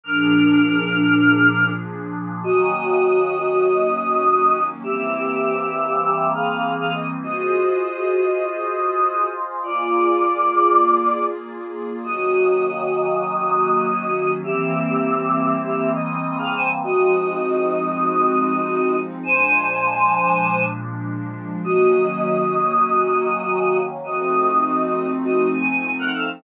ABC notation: X:1
M:4/4
L:1/16
Q:1/4=100
K:Ebdor
V:1 name="Choir Aahs"
[=DB]12 z4 | [Ge]16 | [=G=e]8 [Ge]2 [Af]3 [Af] _e z | [Ge]16 |
[F=d]12 z4 | [Ge]16 | [=G=e]8 [Ge]2 _e3 [Af] [ca] z | [Ge]16 |
[ca]10 z6 | [Ge]16 | [Ge]8 [Ge]2 a3 [Bg] [=Af] z |]
V:2 name="Pad 5 (bowed)"
[B,,F,=DA]16 | [E,G,B,D]16 | [=E,=G,B,C]16 | [FAce]16 |
[B,FA=d]16 | [E,G,B,D]16 | [=E,=G,B,C]16 | [F,A,CE]16 |
[B,,F,A,=D]16 | [E,G,B,D]16 | [F,=A,CE]16 |]